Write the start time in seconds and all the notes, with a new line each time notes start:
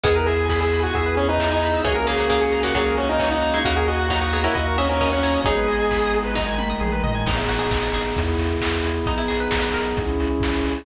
0.03 E2 D#3 B3 E4 G#4, kick, closed hi-hat
0.16 A#4 B4
0.26 G#4 E5, open hi-hat
0.38 G#5
0.49 G#4 B5, kick, snare
0.61 G#4 E6
0.72 B5, open hi-hat
0.83 F#4 G#5
0.93 E2 G#4 E5, kick, closed hi-hat
1.06 B4
1.17 C#4 G#4, open hi-hat
1.28 D#4 B4
1.38 E5, kick, clap
1.51 D#4 G#5
1.61 B5, open hi-hat
1.73 E6
1.84 C#2 E3 A#3 C#4 F#4 G#4, kick, closed hi-hat
1.95 A#4
2.06 C#3 A#3 G#4 C#5, open hi-hat
2.17 C#3 A#3 F#5
2.30 C#3 A#3 G#4 A#5, kick, snare
2.41 G#4 C#6
2.51 A#5, open hi-hat
2.63 C#3 A#3 F#4 F#5
2.74 C#2 A#2 F#3 G#4 C#5, kick, closed hi-hat
2.86 A#4
2.97 C#4 F#4, open hi-hat
3.09 D#4 A#4
3.19 E3 C#4 C#5, kick, clap
3.31 D#4 F#5
3.42 A#5, open hi-hat
3.54 G#3 E4 C#6
3.65 D#2 C#3 A#3 D#4 F#4, kick, closed hi-hat
3.76 G#4 A#4
3.87 F#4 D#5, open hi-hat
3.99 F#5
4.10 F#3 D#4 F#4 A#5, kick, clap
4.21 F#4 D#6
4.32 B3 G#4 A#5, open hi-hat
4.44 C#4 E4 A#4 F#5
4.55 D#2 F#4 D#5, kick, closed hi-hat
4.67 A#4
4.78 C#4 F#4 G#4 E5, open hi-hat
4.89 C#4 A#4
5.00 C#4 A#4 D#5, kick, snare
5.12 C#4 F#5
5.23 E4 C#5 A#5, open hi-hat
5.34 D#6
5.44 G#1 F#3 G#3 B3 D#4 G#4, kick, closed hi-hat
5.57 B4
5.68 D#5, open hi-hat
5.79 G#5
5.91 B5, kick, clap
6.02 D#6
6.13 G#4, open hi-hat
6.25 B4
6.35 D#3 F#3 G#3 D#4 D#5, kick, snare
6.47 G#5
6.58 B5, high tom
6.70 D#6
6.81 A#1 G#4, mid tom
6.92 B4
7.03 A1 D#5, floor tom
7.15 G#5
7.26 G#1 B3 D#4 G#4, kick, crash
7.37 E4, closed hi-hat
7.49 G#1 F#4, open hi-hat
7.59 G#4, closed hi-hat
7.71 G#1, kick, clap
7.83 F#4, closed hi-hat
7.93 G#1 G#4, open hi-hat
8.05 closed hi-hat
8.16 E2 B3 E4 G#4, kick, closed hi-hat
8.28 closed hi-hat
8.39 E2, open hi-hat
8.48 closed hi-hat
8.61 E2, kick, clap
8.74 closed hi-hat
8.84 E2, open hi-hat
8.94 closed hi-hat
9.06 B1 B3 D#4 G#4, kick, closed hi-hat
9.17 E4, closed hi-hat
9.28 B1 G#4, open hi-hat
9.40 B4, closed hi-hat
9.51 B1, kick, snare
9.62 B4, closed hi-hat
9.74 B1 A#4, open hi-hat
9.86 closed hi-hat
9.97 C#2 C#4 E4 G#4, kick, closed hi-hat
10.08 closed hi-hat
10.19 C#2, open hi-hat
10.30 closed hi-hat
10.40 C#2, kick, snare
10.53 closed hi-hat
10.64 C#2, open hi-hat
10.76 open hi-hat